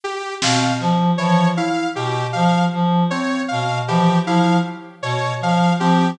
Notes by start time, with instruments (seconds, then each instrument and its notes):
0.04 lead 2 (sawtooth) G4
0.42 clarinet B2, electric piano 2 C4, lead 2 (sawtooth) F5, snare
0.80 clarinet F3, clap
1.18 electric piano 2 E3, clarinet F3, lead 2 (sawtooth) C#5
1.57 electric piano 2 E4, lead 2 (sawtooth) F5
1.95 clarinet B2, lead 2 (sawtooth) G4
2.33 clarinet F3, lead 2 (sawtooth) F5
2.73 clarinet F3
3.10 electric piano 2 C4, lead 2 (sawtooth) C#5
3.48 clarinet B2, lead 2 (sawtooth) F5
3.87 electric piano 2 E3, clarinet F3, lead 2 (sawtooth) G4
4.26 clarinet F3, electric piano 2 E4, lead 2 (sawtooth) F5
5.02 clarinet B2, lead 2 (sawtooth) C#5
5.41 clarinet F3, lead 2 (sawtooth) F5
5.79 clarinet F3, electric piano 2 C4, lead 2 (sawtooth) G4